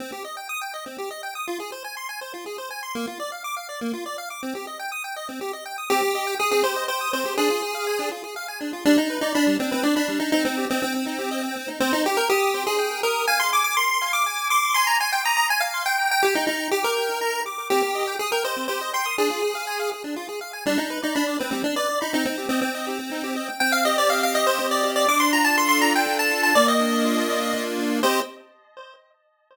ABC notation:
X:1
M:3/4
L:1/16
Q:1/4=122
K:Cm
V:1 name="Lead 1 (square)"
z12 | z12 | z12 | z12 |
G4 A A c2 c2 c2 | A6 z6 | D E2 E D2 C C D D2 E | E C2 C C8 |
C E G B G3 A3 B2 | a c' d' d' c'3 d'3 d'2 | c' b a g b b a f2 g2 g | G E E2 G B5 z2 |
G4 A B c2 c2 c'2 | A6 z6 | D E2 E D2 C C D d2 E | E C2 C C8 |
g f e d f f e c2 d2 d | d' c' b =a c' c' b g2 a2 a | d e9 z2 | c4 z8 |]
V:2 name="Lead 1 (square)"
C G e g e' g e C G e g e' | F A c a c' a c F A c a c' | B, F d f d' f d B, F d f d' | C G e g e' g e C G e g e' |
C G e g e' C G e g e' C G | D F A f a D F A f a D F | G, D =B d =b G, D B d b G, D | C E G e g C E G e g C E |
c2 g2 e'2 c2 g2 e'2 | f2 a2 c'2 f2 a2 c'2 | a2 c'2 e'2 a2 c'2 g2- | g2 b2 d'2 g2 b2 d'2 |
C G e g e' g e C G e g e' | D F A f a f A D F A f a | G, D =B d =b d B G, D B d b | C E G e g e G C E G e g |
C2 G2 e2 G2 C2 G2 | D2 F2 =A2 F2 D2 F2 | B,2 D2 F2 D2 B,2 D2 | [CGe]4 z8 |]